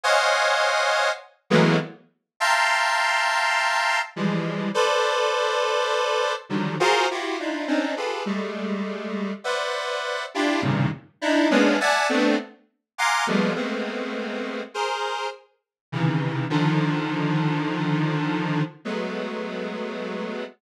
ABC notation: X:1
M:7/8
L:1/16
Q:1/4=51
K:none
V:1 name="Lead 1 (square)"
[c^c^df^f^g]4 z [E,^F,^G,A,^A,B,] z2 [e=f=g=a^a=c']6 | [E,F,G,^G,]2 [ABcd]6 [D,^D,F,^F,=G,] [=F^F^G^Ac] [E=F^F=G] [=D^DE=F] [C^C=D^D] [FG^G=AB] | [G,^G,A,]4 [Bcde^f]3 [DE=F=G] [G,,A,,^A,,C,^C,^D,] z [=D^DE] [^G,^A,B,^C=D] [de^f^g=a] [=A,B,=CD] | z2 [f^f^g^ac'd'] [=F,=G,^G,=A,^A,B,] [G,=A,^A,B,C]4 [^G^Ac]2 z2 [C,^C,^D,E,]2 |
[D,^D,F,]8 [^F,^G,A,B,]6 |]